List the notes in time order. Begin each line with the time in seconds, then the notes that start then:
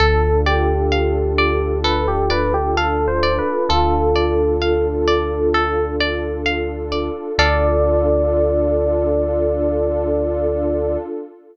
0.00 D2 D4 F4 A4
0.46 G4 D5
0.92 F5
1.38 D5
1.84 A4 B4
2.08 G4
2.30 B4 D5
2.54 G4
2.77 A4 F5
3.08 C5
3.23 D5
3.38 B4
3.69 D2 F4 A4
4.16 D5
4.62 F5
5.08 D5
5.54 A4
6.00 D5
6.46 F5
6.92 D5
7.38 D2 D4 F4 A4 D5 F5